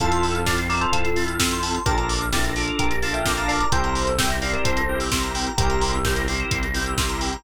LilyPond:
<<
  \new Staff \with { instrumentName = "Electric Piano 2" } { \time 4/4 \key f \major \tempo 4 = 129 <f' a'>4 <d'' f''>16 r16 <bes' d''>16 <a' c''>16 <f' a'>8. r4 r16 | <g' bes'>16 r8. <e' g'>16 r8. <g' bes'>8 <f'' a''>16 <e'' g''>8 <f'' a''>16 <d'' f''>16 <bes' d''>16 | <a' c''>4 <e'' g''>16 r16 <d'' f''>16 <bes' d''>16 <a' c''>8. r4 r16 | <g' bes'>4. r2 r8 | }
  \new Staff \with { instrumentName = "Drawbar Organ" } { \time 4/4 \key f \major <c' e' f' a'>4 <c' e' f' a'>8 <c' e' f' a'>4 <c' e' f' a'>8 <c' e' f' a'>4 | <d' f' a' bes'>4 <d' f' a' bes'>8 <d' f' a' bes'>4 <d' f' a' bes'>8 <d' f' a' bes'>4 | <c' e' g' bes'>4 <c' e' g' bes'>8 <c' e' g' bes'>4 <c' e' g' bes'>8 <c' e' g' bes'>4 | <c' e' g' bes'>4 <c' e' g' bes'>8 <c' e' g' bes'>4 <c' e' g' bes'>8 <c' e' g' bes'>4 | }
  \new Staff \with { instrumentName = "Electric Piano 2" } { \time 4/4 \key f \major a''16 c'''16 e'''16 f'''16 a'''16 c''''16 e''''16 f''''16 e''''16 c''''16 a'''16 f'''16 e'''16 c'''16 a''16 c'''16 | a''16 bes''16 d'''16 f'''16 a'''16 bes'''16 d''''16 f''''16 d''''16 bes'''16 a'''16 f'''16 d'''16 bes''16 a''16 bes''16 | g''16 bes''16 c'''16 e'''16 g'''16 bes'''16 c''''16 e''''16 c''''16 bes'''16 g'''16 e'''16 c'''16 bes''16 g''16 bes''16 | g''16 bes''16 c'''16 e'''16 g'''16 bes'''16 c''''16 e''''16 c''''16 bes'''16 g'''16 e'''16 c'''16 bes''16 g''16 bes''16 | }
  \new Staff \with { instrumentName = "Synth Bass 1" } { \clef bass \time 4/4 \key f \major f,2 f,2 | bes,,2 bes,,2 | c,2 c,2 | c,2 c,2 | }
  \new DrumStaff \with { instrumentName = "Drums" } \drummode { \time 4/4 <hh bd>16 hh16 hho16 hh16 <bd sn>16 hh16 hho16 hh16 <hh bd>16 hh16 hho16 hh16 <bd sn>16 hh16 hho16 hh16 | <hh bd>16 hh16 hho16 hh16 <bd sn>16 hh16 hho16 hh16 <hh bd>16 hh16 hho16 hh16 <bd sn>16 hh16 hho16 hh16 | <hh bd>16 hh16 hho16 hh16 <bd sn>16 hh16 hho16 hh16 <hh bd>16 hh8 hho16 <bd sn>16 hh16 hho16 hh16 | <hh bd>16 hh16 hho16 hh16 <bd sn>16 hh16 hho16 hh16 <hh bd>16 hh16 hho16 hh16 <bd sn>16 hh16 hho16 hh16 | }
>>